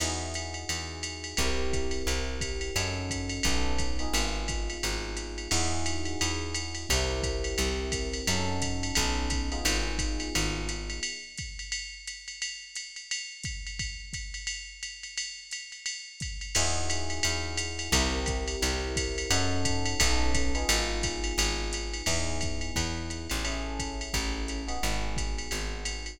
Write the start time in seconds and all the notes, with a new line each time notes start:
0.00 E2 D#4 E4 F#4 G#4, crash, ride
0.34 hi-hat pedal, ride
0.54 ride
0.69 E2, ride
1.03 hi-hat pedal, ride
1.24 ride
1.37 C2 C4 E4 G4 A#4, kick, ride
1.73 kick, hi-hat pedal, ride
1.91 ride
2.07 C2, ride
2.41 kick, hi-hat pedal, ride
2.61 ride
2.76 F#2 C#4 D#4 F#4 A4, ride
3.10 kick, hi-hat pedal, ride
3.29 ride
3.43 B1 B3 C#4 D#4 A4, kick, ride
3.79 kick, hi-hat pedal, ride
3.99 B3 D#4 F4 G#4, ride
4.14 G#1, ride
4.48 kick, hi-hat pedal, ride
4.70 ride
4.83 G#1, ride
5.17 hi-hat pedal, ride
5.38 ride
5.51 E2 D#4 E4 F#4 G#4, crash, ride
5.86 hi-hat pedal, ride
6.05 ride
6.21 E2, ride
6.55 hi-hat pedal, ride
6.75 ride
6.89 C2 C4 E4 G4 A#4, kick, ride
7.23 kick, hi-hat pedal, ride
7.44 ride
7.58 C2, ride
7.92 kick, hi-hat pedal, ride
8.14 ride
8.27 F#2 C#4 D#4 F#4 A4, ride
8.62 kick, hi-hat pedal, ride
8.83 ride
8.95 B1 B3 C#4 D#4 A4, kick, ride
9.30 kick, hi-hat pedal, ride
9.52 B3 D#4 F4 G#4, ride
9.65 G#1, ride
9.98 kick, hi-hat pedal, ride
10.20 ride
10.35 G#1, ride
10.69 hi-hat pedal, ride
10.90 ride
11.03 ride
11.38 kick, hi-hat pedal, ride
11.59 ride
11.72 ride
12.07 hi-hat pedal, ride
12.28 ride
12.42 ride
12.75 hi-hat pedal, ride
12.96 ride
13.11 ride
13.44 kick, hi-hat pedal, ride
13.67 ride
13.79 kick, ride
14.13 kick, hi-hat pedal, ride
14.34 ride
14.47 ride
14.83 hi-hat pedal, ride
15.03 ride
15.18 ride
15.51 hi-hat pedal, ride
15.72 ride
15.86 ride
16.20 kick, hi-hat pedal, ride
16.41 ride
16.55 E2 D#4 E4 F#4 G#4, crash, ride
16.90 hi-hat pedal, ride
17.10 ride
17.23 E2, ride
17.57 hi-hat pedal, ride
17.79 ride
17.92 C2 C4 E4 G4 A#4, kick, ride
18.26 kick, hi-hat pedal, ride
18.48 ride
18.62 C2, ride
18.96 kick, hi-hat pedal, ride
19.18 ride
19.30 F#2 C#4 D#4 F#4 A4, ride
19.65 kick, hi-hat pedal, ride
19.86 ride
20.00 B1 B3 C#4 D#4 A4, kick, ride
20.34 kick, hi-hat pedal, ride
20.55 B3 D#4 F4 G#4, ride
20.69 G#1, ride
21.03 kick, hi-hat pedal, ride
21.24 ride
21.38 G#1, ride
21.73 hi-hat pedal, ride
21.94 ride
22.06 E2 B3 D#4 E4 G#4, kick, crash, ride
22.41 kick, hi-hat pedal, ride
22.61 ride
22.76 E2, kick, ride
23.10 hi-hat pedal, ride
23.30 A1, ride
23.44 C#4 E4 G#4 A4, ride
23.79 kick, hi-hat pedal, ride
24.01 ride
24.14 A1, kick, ride
24.48 hi-hat pedal, ride
24.68 B3 D#4 F#4 G#4, ride
24.83 G#1, ride
25.16 kick, hi-hat pedal, ride
25.38 ride
25.51 G#1, ride
25.85 hi-hat pedal, ride
26.06 ride